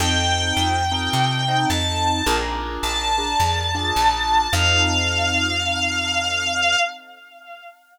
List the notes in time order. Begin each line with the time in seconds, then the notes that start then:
0.00 F2 C4 D#4 F4 A4 G5
0.57 F2
0.92 C4 D#4 F4 A4
1.13 C3
1.48 C4 D#4 F4 A4
1.70 F2 A5
2.26 A#1 D4 F4 G#4 A#4
2.83 A#1 A5
3.18 D4 F4 G#4 A#4
3.40 F2
3.75 D4 F4 G#4 A#4
3.96 A#1
4.53 F2 C4 D#4 F4 A4 F5